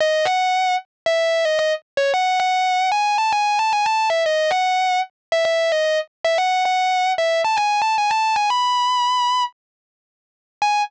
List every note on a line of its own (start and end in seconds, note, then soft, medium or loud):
0.00 0.26 D#5 loud
0.25 0.74 F#5 medium
1.06 1.18 E5 loud
1.18 1.44 E5 medium
1.45 1.58 D#5 medium
1.59 1.71 D#5 medium
1.97 2.10 C#5 medium
2.14 2.38 F#5 loud
2.40 2.89 F#5 medium
2.92 3.15 G#5 loud
3.18 3.31 A5 loud
3.32 3.58 G#5 medium
3.59 3.71 A5 medium
3.73 3.85 G#5 loud
3.85 4.07 A5 loud
4.10 4.22 E5 medium
4.26 4.50 D#5 loud
4.51 4.99 F#5 medium
5.32 5.44 E5 loud
5.45 5.69 E5 loud
5.72 5.84 D#5 loud
5.84 5.97 D#5 medium
6.24 6.37 E5 medium
6.38 6.62 F#5 loud
6.65 7.11 F#5 medium
7.18 7.40 E5 medium
7.44 7.57 A5 medium
7.57 7.79 G#5 medium
7.82 7.94 A5 medium
7.98 8.11 G#5 loud
8.10 8.34 A5 loud
8.36 8.49 G#5 medium
8.50 9.42 B5 loud
10.62 10.80 G#5 loud